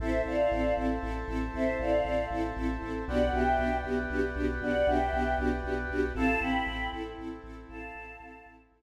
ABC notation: X:1
M:6/8
L:1/8
Q:3/8=78
K:Am
V:1 name="Choir Aahs"
[ce] [df]2 z3 | [ce] [df]2 z3 | [d^f] [eg]2 z3 | [d^f] [eg]2 z3 |
[fa] [gb]2 z3 | [fa]4 z2 |]
V:2 name="String Ensemble 1"
[CEA] [CEA] [CEA] [CEA] [CEA] [CEA] | [CEA] [CEA] [CEA] [CEA] [CEA] [CEA] | [B,D^FG] [B,DFG] [B,DFG] [B,DFG] [B,DFG] [B,DFG] | [B,D^FG] [B,DFG] [B,DFG] [B,DFG] [B,DFG] [B,DFG] |
[CEA] [CEA] [CEA] [CEA] [CEA] [CEA] | [CEA] [CEA] [CEA] [CEA] [CEA] z |]
V:3 name="Synth Bass 2" clef=bass
A,,, A,,, A,,, A,,, A,,, A,,, | A,,, A,,, A,,, A,,, A,,, A,,, | B,,, B,,, B,,, B,,, B,,, B,,, | B,,, B,,, B,,, B,,, B,,, B,,, |
A,,, A,,, A,,, A,,, A,,, A,,, | A,,, A,,, A,,, A,,, A,,, z |]
V:4 name="Brass Section"
[cea]6- | [cea]6 | [Bd^fg]6- | [Bd^fg]6 |
[CEA]6- | [CEA]6 |]